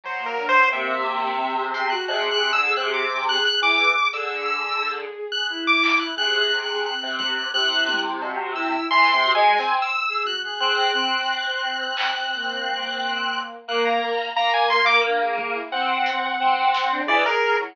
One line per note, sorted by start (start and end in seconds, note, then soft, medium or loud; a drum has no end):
0.04 0.65 F#3 medium
0.04 0.26 C5 soft
0.19 0.34 A#3 medium
0.26 0.47 A#4 medium
0.37 0.52 D4 medium
0.37 floor tom medium
0.49 0.69 C5 loud
0.70 1.94 C3 loud
0.70 1.31 A#3 medium
0.70 1.65 E5 soft
1.40 1.56 C4 medium
1.58 1.88 G#4 medium
1.74 1.89 C6 medium
1.74 closed hi-hat medium
1.90 2.07 F#4 loud
1.90 2.05 F#6 medium
2.08 2.29 C3 medium
2.08 3.01 G#4 medium
2.08 2.29 F#6 medium
2.08 cowbell loud
2.31 2.52 C3 medium
2.31 2.52 F#6 loud
2.53 2.74 D3 medium
2.53 2.73 E6 loud
2.76 3.38 C3 loud
2.76 2.92 F#6 medium
2.94 3.24 D6 medium
3.10 3.25 G#4 medium
3.27 3.43 G#4 medium
3.27 3.44 F#6 loud
3.45 4.06 G#4 soft
3.45 3.61 F#6 loud
3.45 closed hi-hat medium
3.62 3.92 E3 medium
3.62 4.09 D6 loud
3.79 floor tom medium
4.13 5.05 D3 medium
4.13 4.46 G#4 medium
4.13 4.44 E6 medium
4.13 closed hi-hat medium
4.46 4.78 G#4 medium
4.46 4.92 E6 medium
4.81 5.27 G#4 medium
5.32 5.49 G#4 medium
5.32 5.47 F#6 medium
5.49 6.11 E4 loud
5.49 5.64 F#6 medium
5.67 5.98 D6 loud
5.83 clap loud
6.00 6.15 F#6 medium
6.16 6.94 C3 medium
6.16 6.47 G#4 medium
6.16 6.38 F#6 loud
6.16 floor tom medium
6.38 6.59 F#6 loud
6.52 6.67 G#4 medium
6.63 6.84 F#6 medium
6.69 6.84 G#4 medium
6.84 7.46 C4 medium
6.84 7.17 F#6 medium
7.03 7.49 C3 medium
7.19 7.34 F#6 medium
7.19 kick loud
7.36 7.51 F#6 medium
7.53 8.76 C3 medium
7.53 8.16 E4 medium
7.53 8.00 F#6 loud
7.88 high tom loud
8.22 8.53 F#4 medium
8.22 cowbell medium
8.55 8.85 E4 loud
8.55 8.86 E6 medium
8.90 9.11 E3 loud
8.90 9.32 C6 loud
9.13 9.33 C3 medium
9.23 9.39 F#4 medium
9.23 floor tom medium
9.35 9.56 G#3 loud
9.35 9.76 G#5 medium
9.43 9.58 G#4 soft
9.58 9.89 C4 medium
9.58 snare medium
9.82 10.23 E6 medium
10.09 10.24 G#4 medium
10.24 10.40 F#4 medium
10.24 10.42 F#6 medium
10.24 high tom medium
10.44 10.59 G#4 medium
10.44 10.60 F#6 medium
10.60 10.91 C4 medium
10.60 10.90 G#4 medium
10.60 10.76 F#6 medium
10.77 10.92 F#6 medium
10.93 11.24 C4 loud
10.93 13.40 C4 medium
10.93 13.39 F#6 medium
11.97 clap loud
12.33 13.56 A#3 medium
12.65 high tom medium
13.67 13.98 A#3 loud
13.67 14.29 A#3 medium
13.67 13.84 F#6 medium
13.85 14.31 A#5 medium
14.36 15.58 A#3 medium
14.36 14.52 A#5 loud
14.54 14.69 G#5 medium
14.70 15.01 A#3 medium
14.70 14.85 C6 loud
14.86 15.01 D6 loud
15.03 15.18 D4 medium
15.21 15.36 G#4 medium
15.38 15.55 G#4 medium
15.38 kick loud
15.54 15.69 E4 medium
15.72 16.33 C4 medium
15.72 16.64 C4 medium
15.72 16.95 F#5 medium
16.06 closed hi-hat loud
16.40 17.01 C4 medium
16.40 high tom medium
16.74 snare loud
16.91 17.06 D4 loud
17.06 17.24 E3 loud
17.06 17.22 G#4 loud
17.06 17.24 D5 loud
17.25 17.56 G#4 loud
17.25 17.57 A#4 loud
17.59 17.75 F#3 medium
17.59 17.74 E4 medium